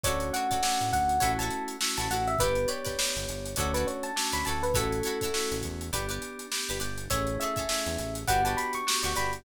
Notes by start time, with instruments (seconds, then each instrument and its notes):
0.03 synth bass 1 D2, electric piano 2 A3 C#4 D4 F#4, pizzicato strings A4 C#5 D5, electric piano 1 C#5, kick, closed hi-hat
0.08 pizzicato strings F#4
0.20 closed hi-hat
0.33 pizzicato strings F#4 A4 C#5 D5, electric piano 1 F#5, closed hi-hat
0.51 pizzicato strings F#4 A4 C#5 D5, kick, closed hi-hat
0.63 electric piano 2 A3 C#4 D4 F#4, snare
0.81 synth bass 1 A2, closed hi-hat
0.92 synth bass 1 D2, electric piano 1 F#5, kick, closed hi-hat
1.09 closed hi-hat
1.20 synth bass 1 A1, electric piano 2 A3 C#4 E4 F#4, pizzicato strings E4 F#4 A4 C#5, kick, closed hi-hat
1.39 pizzicato strings E4 F#4 A4 C#5, electric piano 1 A5, closed hi-hat
1.50 closed hi-hat
1.68 closed hi-hat
1.81 electric piano 2 A3 C#4 E4 F#4, snare
1.97 synth bass 1 A1, pizzicato strings E4 F#4 A4 C#5, electric piano 1 A5, closed hi-hat
2.10 synth bass 1 A1, pizzicato strings E4 F#4 A4 C#5, electric piano 1 F#5, closed hi-hat
2.27 electric piano 1 E5, closed hi-hat
2.39 synth bass 1 G1, electric piano 2 B3 D4 G4, pizzicato strings G4 B4 D5, electric piano 1 B4, kick, closed hi-hat
2.55 closed hi-hat
2.68 pizzicato strings G4 B4 D5, electric piano 1 C#5, closed hi-hat
2.85 pizzicato strings G4 B4 D5, kick, snare, closed hi-hat
2.98 electric piano 2 B3 D4 G4, snare
3.16 synth bass 1 G1, closed hi-hat
3.28 synth bass 1 G1, closed hi-hat
3.45 closed hi-hat
3.56 synth bass 1 D2, electric piano 2 A3 C#4 D4 F#4, pizzicato strings A4 C#5 D5, electric piano 1 C#5, kick, closed hi-hat
3.60 pizzicato strings F#4
3.74 pizzicato strings F#4 A4 C#5 D5, electric piano 1 B4, closed hi-hat
3.87 electric piano 1 C#5, closed hi-hat
4.03 electric piano 1 A5, closed hi-hat
4.16 electric piano 2 A3 C#4 D4 F#4, snare
4.32 synth bass 1 D2, pizzicato strings F#4 A4 C#5 D5, electric piano 1 B5, closed hi-hat
4.45 synth bass 1 D2, pizzicato strings A4 C#5 D5, electric piano 1 A5, closed hi-hat
4.49 pizzicato strings F#4
4.63 electric piano 1 B4, closed hi-hat
4.74 synth bass 1 A1, electric piano 2 A3 C#4 E4 F#4, pizzicato strings E4 F#4 A4 C#5, electric piano 1 A4, kick, closed hi-hat
4.92 closed hi-hat
5.03 pizzicato strings F#4 A4 C#5, closed hi-hat
5.07 pizzicato strings E4
5.21 pizzicato strings E4 F#4 A4 C#5, kick, closed hi-hat
5.34 electric piano 2 A3 C#4 E4 F#4, snare
5.51 synth bass 1 A1, closed hi-hat
5.62 synth bass 1 E2, kick, closed hi-hat
5.81 closed hi-hat
5.93 synth bass 1 G1, electric piano 2 B3 D4 G4, pizzicato strings G4 B4 D5, kick, closed hi-hat
6.09 pizzicato strings G4 B4 D5, closed hi-hat
6.22 closed hi-hat
6.39 closed hi-hat
6.51 electric piano 2 B3 D4 G4, snare
6.69 synth bass 1 G1, pizzicato strings G4 B4 D5, closed hi-hat
6.80 synth bass 1 G1, pizzicato strings G4 B4 D5, closed hi-hat
6.98 closed hi-hat
7.10 synth bass 1 A1, electric piano 2 A3 C#4 E4 G#4, pizzicato strings G#4 A4 C#5 E5, electric piano 1 C#5, kick, closed hi-hat
7.27 closed hi-hat
7.40 pizzicato strings G#4 A4 C#5 E5, electric piano 1 E5, closed hi-hat
7.56 pizzicato strings G#4 A4 C#5 E5, kick, closed hi-hat
7.69 electric piano 2 A3 C#4 E4 G#4, snare
7.86 synth bass 1 E2, closed hi-hat
7.98 synth bass 1 A1, closed hi-hat
8.15 closed hi-hat
8.27 synth bass 1 G1, electric piano 2 B3 D4 F#4 G4, pizzicato strings F#4 G4 B4 D5, electric piano 1 F#5, kick, closed hi-hat
8.45 pizzicato strings F#4 G4 B4 D5, electric piano 1 A5, closed hi-hat
8.57 electric piano 1 B5, closed hi-hat
8.73 electric piano 1 C#6, closed hi-hat
8.87 electric piano 2 B3 D4 F#4 G4, snare
9.03 synth bass 1 D2, pizzicato strings F#4 G4 B4 D5, electric piano 1 C#6, closed hi-hat
9.15 synth bass 1 G1, pizzicato strings F#4 G4 B4 D5, electric piano 1 B5, snare, closed hi-hat
9.33 closed hi-hat